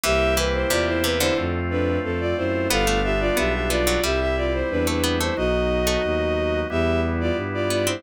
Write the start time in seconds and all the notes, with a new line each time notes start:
0.03 C2 E3 A#3 C4 E4 G4 E5
0.37 E3 B4
0.54 E4 C5
0.70 E2 C3 F4 D5
0.87 E4 C5
1.04 C3 B4
1.20 D3 E4 C5
1.38 F2 A3 C4 F4
1.70 D4 B4
2.04 F2 C4 A4
2.20 F4 D5
2.37 F#2 E4 C5
2.70 G1 G3 B3 D4 F4 A4 F5
2.87 A3
3.04 G4 E5
3.20 F4 D5
3.37 B1 B3 G4 E5
3.54 G4 E5
3.70 B3 F4 D5
3.87 F#3
4.03 C2 G3 C4 E4 G4 E5
4.20 G4 E5
4.37 F4 D5
4.54 E4 C5
4.70 E2 D4 B4
4.87 A3 D4 B4
5.03 B3
5.20 A3 E4 C5
5.37 B1 F#3 B3 D#4 F#4 D#5
5.87 A3
6.04 D#2
6.70 E2 G3 B3 E4 G4 E5
7.20 F4 D5
7.36 G2
7.54 F4 D5
7.70 B3 F4 D5
7.87 C4 E4 C5